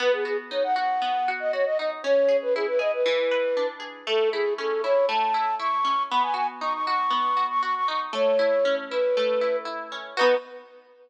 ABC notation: X:1
M:4/4
L:1/16
Q:1/4=118
K:Bmix
V:1 name="Flute"
B G G z c f f5 d c d d z | c3 B G B d B7 z2 | A2 G2 A2 c2 a4 c'4 | b g g z c' c' c'5 c' c' c' c' z |
c6 B6 z4 | B4 z12 |]
V:2 name="Acoustic Guitar (steel)"
B,2 F2 D2 F2 B,2 F2 F2 D2 | C2 G2 E2 G2 E,2 B2 =D2 G2 | A,2 E2 C2 E2 A,2 E2 E2 C2 | B,2 F2 D2 F2 B,2 F2 F2 D2 |
A,2 E2 C2 E2 A,2 E2 E2 C2 | [B,DF]4 z12 |]